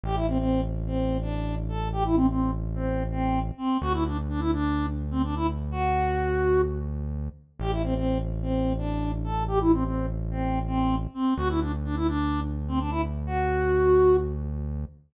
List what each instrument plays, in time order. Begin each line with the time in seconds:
0.03 synth bass 1 A1, ocarina G4
0.15 ocarina E4
0.28 ocarina C4
0.38 ocarina C4
0.86 ocarina C4
1.21 ocarina D4
1.69 ocarina A4
1.92 ocarina G4
2.05 ocarina E4
2.15 ocarina C4
2.29 ocarina C4
2.75 ocarina C4
3.11 ocarina C4
3.57 ocarina C4
3.81 synth bass 1 D2, ocarina F#4
3.93 ocarina E4
4.06 ocarina D4
4.29 ocarina D4
4.40 ocarina E4
4.53 ocarina D4
5.11 ocarina C4
5.24 ocarina D4
5.36 ocarina E4
5.71 ocarina F#4
7.59 synth bass 1 A1, ocarina G4
7.71 ocarina E4
7.83 ocarina C4
7.95 ocarina C4
8.42 ocarina C4
8.78 ocarina D4
9.24 ocarina A4
9.48 ocarina G4
9.60 ocarina E4
9.73 ocarina C4
9.84 ocarina C4
10.31 ocarina C4
10.67 ocarina C4
11.14 ocarina C4
11.37 synth bass 1 D2, ocarina F#4
11.49 ocarina E4
11.61 ocarina D4
11.84 ocarina D4
11.96 ocarina E4
12.07 ocarina D4
12.68 ocarina C4
12.79 ocarina D4
12.90 ocarina E4
13.26 ocarina F#4